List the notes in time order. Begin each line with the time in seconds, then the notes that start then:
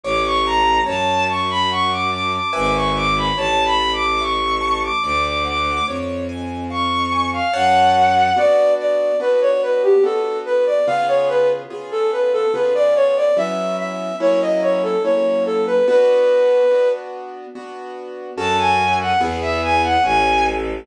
0.03 A1 C#5 D6
0.25 C#6
0.45 A5 A#5
0.86 F#2 C#5 A5
1.28 A5 C#6
1.50 B5
1.70 F#5 C#6
1.91 D6
2.12 A5 D6
2.33 D6
2.53 G#1 B4 E5 G#5 D6
2.75 C#6
2.95 D6
3.16 B5
3.36 A1 C#5 A5
3.65 B5
3.79 A5
3.93 D6
4.20 E5 C#6
4.61 A5
4.83 D6
5.03 D2 D5 D6
5.25 D6
5.45 F#5 D6
5.86 F2 C#5
6.29 G#5
6.70 F5 C#6
7.12 G#5
7.33 F5
7.53 F#2 C#5 F#5 A5
8.36 B3 D4 F#4 D5
8.79 D5
9.20 B3 D4 F#4 B4
9.41 C#5
9.62 B4
9.83 G4
10.03 B3 D4 F#4 A4
10.45 B4
10.66 D5
10.87 C#3 B3 F4 G#4 F5
11.08 C#5
11.29 B4
11.70 C#3 B3 F4 G#4
11.91 A4
12.12 B4
12.33 A4
12.54 C#3 B3 F4 G#4 B4
12.75 D5
12.95 C#5
13.16 D5
13.37 F#3 B3 C#4 E4 E5
13.79 E5
14.20 F#3 A#3 C#4 E4 C#5
14.41 D#5
14.62 C#5
14.83 A4
15.04 F#3 A#3 C#4 E4 C#5
15.45 A4
15.66 B4
15.87 B3 D4 F#4 B4
16.71 B3 D4 F#4
17.55 B3 D4 F#4
18.36 F#2 C#4 F#4 A4 A5
18.58 G#5
19.00 F#5
19.20 E2 B3 E4 G#4
19.41 E5
19.62 G#5
19.83 F#5
20.03 A1 C#4 G#5
20.46 A4